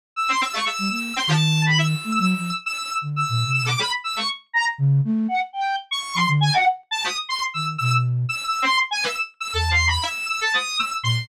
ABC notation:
X:1
M:5/8
L:1/16
Q:1/4=120
K:none
V:1 name="Flute"
z6 G, _B,2 z | _E,6 (3A,2 _G,2 F,2 | z4 D,2 (3_B,,2 C,2 =B,,2 | z8 _D,2 |
A,2 z7 F, | D,2 z8 | _E,2 B,,4 z4 | z6 E,,4 |
z8 _B,,2 |]
V:2 name="Choir Aahs"
z e' c' e' _d' e'2 e'2 c' | a3 b e'3 e'3 | z e' e' z2 e'3 e' d' | b z e' _d' z2 _b z3 |
z2 _g z =g2 z _d'2 c' | z _a _g z2 =a _e' z c' z | e' z e' z3 (3e'2 e'2 c'2 | z _a e' z2 e' (3=a2 c'2 b2 |
e'2 e' a _e'2 =e' z c'2 |]